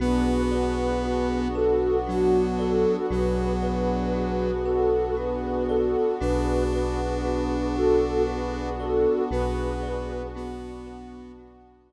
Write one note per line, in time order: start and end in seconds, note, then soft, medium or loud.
0.00 2.86 B1 loud
0.00 3.07 B3 medium
0.00 1.48 B3 loud
0.00 3.07 D4 medium
0.00 1.03 F#4 medium
0.00 3.07 F#4 medium
0.00 0.42 G#4 medium
0.00 0.42 B4 loud
0.51 1.39 G#4 medium
0.51 1.39 B4 medium
0.51 2.58 D5 medium
1.03 2.06 F#4 medium
1.55 1.97 F#4 medium
1.55 1.97 A4 medium
1.55 3.03 B4 medium
2.06 2.97 F#3 loud
2.06 2.48 D4 medium
2.06 2.48 F#4 medium
2.06 3.05 F#4 medium
2.58 3.06 F#4 medium
2.58 3.06 A4 medium
2.58 3.08 D5 medium
3.10 5.96 B1 loud
3.10 4.51 F#3 loud
3.10 6.18 B3 medium
3.10 6.18 D4 medium
3.10 4.13 F#4 medium
3.10 6.18 F#4 medium
3.10 3.52 G#4 medium
3.10 3.52 B4 medium
3.62 4.62 G#4 medium
3.62 4.62 B4 medium
3.62 5.69 D5 medium
4.14 5.16 F#4 medium
4.65 5.15 F#4 medium
4.65 5.15 A4 medium
4.65 6.13 B4 medium
5.17 6.15 F#4 medium
5.17 5.64 G#4 medium
5.17 5.64 B4 medium
5.69 6.15 F#4 medium
5.69 6.15 A4 medium
5.69 6.18 D5 medium
6.20 9.06 B1 loud
6.20 9.28 B3 medium
6.20 8.69 D4 loud
6.20 9.28 D4 medium
6.20 7.24 F#4 loud
6.20 9.28 F#4 medium
6.20 6.63 G#4 medium
6.20 6.63 B4 loud
6.73 7.74 G#4 medium
6.73 7.74 B4 medium
6.73 8.79 D5 medium
7.24 8.27 F#4 medium
7.76 8.22 F#4 medium
7.76 8.22 A4 medium
7.76 9.23 B4 medium
8.27 9.26 F#4 medium
8.27 8.72 G#4 medium
8.27 8.72 B4 medium
8.80 9.22 F#4 medium
8.80 9.22 A4 medium
8.80 9.29 D5 medium
9.31 11.92 B1 loud
9.31 11.92 B3 medium
9.31 10.22 B3 loud
9.31 11.92 D4 medium
9.31 11.92 F#4 medium
9.31 10.34 F#4 medium
9.31 10.27 G#4 medium
9.31 10.27 B4 loud
9.83 11.89 D5 medium
10.35 11.32 B3 loud
10.35 11.38 F#4 medium
10.87 11.92 B4 medium
11.38 11.92 F#4 medium
11.90 11.92 D5 medium